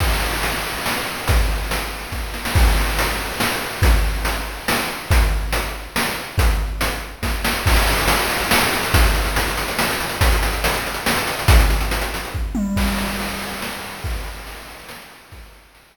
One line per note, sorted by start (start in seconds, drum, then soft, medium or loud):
0.00 kick medium
0.00 crash loud
0.43 closed hi-hat loud
0.86 snare loud
1.28 kick loud
1.28 closed hi-hat loud
1.71 closed hi-hat loud
2.12 kick medium
2.12 snare medium
2.34 snare medium
2.45 snare loud
2.55 kick loud
2.55 crash loud
2.99 closed hi-hat loud
3.40 snare loud
3.82 kick loud
3.82 closed hi-hat loud
4.25 closed hi-hat loud
4.68 snare loud
5.11 kick loud
5.11 closed hi-hat loud
5.52 closed hi-hat loud
5.96 snare loud
6.38 kick loud
6.38 closed hi-hat loud
6.81 closed hi-hat loud
7.23 kick medium
7.23 snare medium
7.45 snare loud
7.66 kick loud
7.66 crash loud
7.76 closed hi-hat medium
7.87 closed hi-hat medium
7.98 closed hi-hat medium
8.08 closed hi-hat loud
8.19 closed hi-hat medium
8.30 closed hi-hat medium
8.40 closed hi-hat medium
8.51 snare loud
8.62 closed hi-hat medium
8.73 closed hi-hat medium
8.83 closed hi-hat medium
8.94 kick loud
8.94 closed hi-hat loud
9.04 closed hi-hat medium
9.15 closed hi-hat medium
9.25 closed hi-hat medium
9.36 closed hi-hat loud
9.48 closed hi-hat medium
9.57 closed hi-hat medium
9.68 closed hi-hat medium
9.79 snare loud
9.91 closed hi-hat medium
10.00 closed hi-hat medium
10.09 closed hi-hat medium
10.21 kick loud
10.21 closed hi-hat loud
10.32 closed hi-hat medium
10.43 closed hi-hat loud
10.53 closed hi-hat medium
10.64 closed hi-hat loud
10.74 closed hi-hat medium
10.86 closed hi-hat medium
10.94 closed hi-hat medium
11.06 snare loud
11.17 closed hi-hat medium
11.27 closed hi-hat medium
11.39 closed hi-hat medium
11.48 kick loud
11.48 closed hi-hat loud
11.60 closed hi-hat medium
11.70 closed hi-hat medium
11.81 closed hi-hat medium
11.91 closed hi-hat loud
12.01 closed hi-hat medium
12.14 closed hi-hat loud
12.25 closed hi-hat medium
12.34 kick medium
12.55 high tom loud
12.76 kick loud
12.76 crash loud
12.98 ride medium
13.19 ride loud
13.41 ride medium
13.62 snare loud
13.84 ride medium
14.04 kick loud
14.04 ride loud
14.24 ride medium
14.47 ride loud
14.67 ride medium
14.89 snare loud
15.10 ride medium
15.32 kick loud
15.32 ride loud
15.52 ride medium
15.75 ride loud